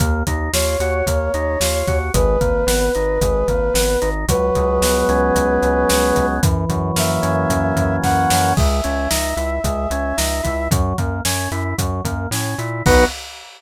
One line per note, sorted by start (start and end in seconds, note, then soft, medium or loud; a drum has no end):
0.00 0.23 D#2 medium
0.00 0.23 A#3 loud
0.00 kick medium
0.00 closed hi-hat medium
0.27 0.49 D#2 medium
0.27 0.51 D#4 medium
0.27 kick medium
0.27 closed hi-hat medium
0.53 0.76 D#2 medium
0.53 0.77 F4 medium
0.53 1.99 C#5 medium
0.53 snare medium
0.80 1.02 D#2 medium
0.80 1.05 F#4 medium
0.80 closed hi-hat medium
1.06 1.29 D#2 medium
1.06 1.32 A#3 medium
1.06 kick medium
1.06 closed hi-hat medium
1.34 1.57 D#2 medium
1.34 1.58 D#4 medium
1.34 closed hi-hat medium
1.60 1.83 D#2 medium
1.60 1.86 F4 medium
1.60 snare medium
1.87 2.10 D#2 medium
1.87 2.12 F#4 medium
1.87 kick medium
1.87 closed hi-hat medium
2.14 2.37 G#1 loud
2.14 2.38 G#3 medium
2.14 4.09 B4 medium
2.14 kick medium
2.14 closed hi-hat medium
2.41 2.64 G#1 medium
2.41 2.65 A#3 medium
2.41 kick medium
2.41 closed hi-hat medium
2.67 2.90 G#1 medium
2.67 2.91 B3 medium
2.67 snare medium
2.95 3.19 G#1 medium
2.95 3.19 D#4 medium
2.95 closed hi-hat medium
3.21 3.44 G#1 medium
3.21 3.47 G#3 medium
3.21 kick medium
3.21 closed hi-hat medium
3.48 3.71 G#1 medium
3.48 3.73 A#3 medium
3.48 kick medium
3.48 closed hi-hat medium
3.74 3.97 G#1 medium
3.74 3.99 B3 medium
3.74 snare medium
4.02 4.25 G#1 medium
4.02 4.26 D#4 medium
4.02 closed hi-hat medium
4.28 4.51 C#2 medium
4.28 5.34 F#3 loud
4.28 6.26 B4 medium
4.28 kick medium
4.28 closed hi-hat loud
4.55 4.79 C#2 medium
4.55 5.62 G#3 medium
4.55 kick medium
4.55 closed hi-hat medium
4.81 5.04 C#2 medium
4.81 5.90 B3 medium
4.81 snare medium
5.09 5.31 C#2 medium
5.09 6.15 C#4 medium
5.09 closed hi-hat medium
5.35 5.58 C#2 medium
5.35 6.36 F#3 medium
5.35 kick medium
5.35 closed hi-hat medium
5.62 5.85 C#2 medium
5.62 6.38 G#3 medium
5.62 closed hi-hat medium
5.89 6.13 C#2 medium
5.89 6.41 B3 medium
5.89 snare medium
6.16 6.40 C#2 medium
6.16 6.41 C#4 medium
6.16 kick medium
6.16 closed hi-hat medium
6.43 6.65 F#2 medium
6.43 7.50 E3 loud
6.43 kick loud
6.43 closed hi-hat loud
6.69 6.92 F#2 medium
6.69 7.76 F#3 medium
6.69 kick medium
6.69 closed hi-hat medium
6.96 7.19 F#2 medium
6.96 8.02 A#3 medium
6.96 7.96 E5 medium
6.96 snare medium
7.22 7.46 F#2 medium
7.22 8.30 C#4 medium
7.22 closed hi-hat medium
7.50 7.73 F#2 medium
7.50 8.53 E3 medium
7.50 kick medium
7.50 closed hi-hat medium
7.76 7.99 F#2 medium
7.76 8.53 F#3 medium
7.76 kick medium
7.76 closed hi-hat medium
8.02 8.27 F#2 medium
8.02 8.53 A#3 medium
8.02 8.53 F#5 medium
8.02 kick medium
8.02 snare medium
8.30 8.54 F#2 medium
8.30 8.56 C#4 medium
8.30 snare medium
8.57 8.81 C#2 medium
8.57 8.81 G#3 medium
8.57 10.69 E5 medium
8.57 kick loud
8.57 crash medium
8.84 9.08 C#2 medium
8.84 9.08 C#4 medium
8.84 closed hi-hat medium
9.10 9.34 C#2 medium
9.10 9.34 D#4 medium
9.10 snare medium
9.37 9.59 C#2 medium
9.37 9.61 E4 medium
9.37 closed hi-hat medium
9.64 9.87 C#2 medium
9.64 9.88 G#3 medium
9.64 kick medium
9.64 closed hi-hat medium
9.90 10.13 C#2 medium
9.90 10.16 C#4 medium
9.90 closed hi-hat medium
10.17 10.41 C#2 medium
10.17 10.41 D#4 medium
10.17 snare medium
10.43 10.68 C#2 medium
10.43 10.68 E4 medium
10.43 kick medium
10.43 closed hi-hat medium
10.71 10.94 F#2 medium
10.71 10.96 F#3 medium
10.71 kick loud
10.71 closed hi-hat loud
10.98 11.21 F#2 medium
10.98 11.22 A#3 medium
10.98 kick medium
10.98 closed hi-hat medium
11.25 11.48 F#2 medium
11.25 11.49 C#4 medium
11.25 snare medium
11.51 11.74 F#2 medium
11.51 11.76 E4 medium
11.51 closed hi-hat medium
11.78 12.01 F#2 medium
11.78 12.02 F#3 medium
11.78 kick medium
11.78 closed hi-hat medium
12.04 12.27 F#2 medium
12.04 12.29 A#3 medium
12.04 kick medium
12.04 closed hi-hat medium
12.31 12.55 A2 medium
12.31 12.57 C#4 medium
12.31 snare medium
12.58 12.82 A#2 medium
12.58 12.83 E4 medium
12.58 closed hi-hat medium
12.86 13.05 B1 loud
12.86 13.05 B3 loud
12.86 13.05 D#4 loud
12.86 13.05 F#4 loud
12.86 13.04 B4 loud
12.86 kick loud
12.86 crash loud